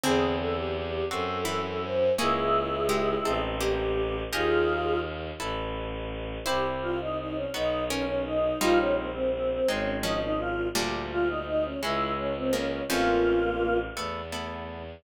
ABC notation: X:1
M:6/8
L:1/16
Q:3/8=56
K:Bblyd
V:1 name="Choir Aahs"
^G2 A =G G2 A2 A2 c2 | [_F_A]8 G4 | [F_A]4 z8 | [K:Dblyd] G z F E E D E2 D D E2 |
F D C C C C D2 E E F2 | G z F E E D _F2 D C D2 | [B,^E]6 z6 |]
V:2 name="Pizzicato Strings"
[D,^B,]8 [E,E]4 | [B,_A]4 [_A,G]4 [B,G]4 | [G_e]10 z2 | [K:Dblyd] [=Ec]8 [DB]4 |
[G,E]8 [F,D]4 | [B,,G,]10 [D,B,]2 | [^E,,^E,]6 z6 |]
V:3 name="Orchestral Harp"
[^B,E^G]6 [C_GA]6 | [_D_F_A]6 [C_E=A]6 | [_E_AB]6 [=E=A=B]6 | [K:Dblyd] [C=EG]6 [_C_E_G]6 |
[B,EF]6 [A,CE]6 | [G,=A,=D]6 [_A,_D_F]6 | [=A,^C^E]6 [A,=B,=E]2 [A,B,E]4 |]
V:4 name="Violin" clef=bass
E,,6 _G,,6 | _D,,6 A,,,6 | _E,,6 A,,,6 | [K:Dblyd] C,,6 _C,,6 |
B,,,6 A,,,6 | =D,,6 _D,,6 | =A,,,6 =E,,6 |]